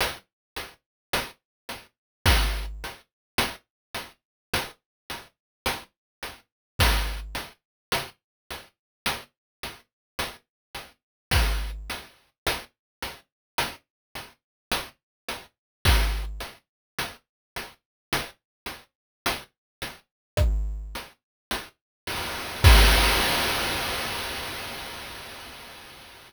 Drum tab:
CC |--------|--------|--------|--------|
HH |xxxx-xxx|xxxx-xxx|xxxx-xxx|xxxx-xxx|
SD |----o---|----o---|----oo--|----o---|
BD |----o---|----o---|----o---|----o---|

CC |--------|x-------|
HH |xxxx-xxo|--------|
SD |----r---|--------|
BD |----o---|o-------|